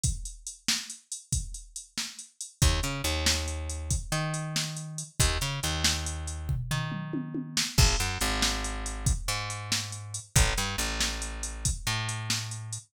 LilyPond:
<<
  \new Staff \with { instrumentName = "Electric Bass (finger)" } { \clef bass \time 12/8 \key ees \major \tempo 4. = 93 r1. | ees,8 des8 ees,2~ ees,8 ees2~ ees8 | ees,8 des8 ees,2~ ees,8 ees2~ ees8 | aes,,8 ges,8 aes,,2~ aes,,8 aes,2~ aes,8 |
a,,8 g,8 a,,2~ a,,8 a,2~ a,8 | }
  \new DrumStaff \with { instrumentName = "Drums" } \drummode { \time 12/8 <hh bd>8 hh8 hh8 sn8 hh8 hh8 <hh bd>8 hh8 hh8 sn8 hh8 hh8 | <hh bd>8 hh8 hh8 sn8 hh8 hh8 <hh bd>8 hh8 hh8 sn8 hh8 hh8 | <hh bd>8 hh8 hh8 sn8 hh8 hh8 <bd tomfh>8 tomfh8 toml8 tommh8 tommh8 sn8 | <cymc bd>8 hh8 hh8 sn8 hh8 hh8 <hh bd>8 hh8 hh8 sn8 hh8 hh8 |
<hh bd>8 hh8 hh8 sn8 hh8 hh8 <hh bd>8 hh8 hh8 sn8 hh8 hh8 | }
>>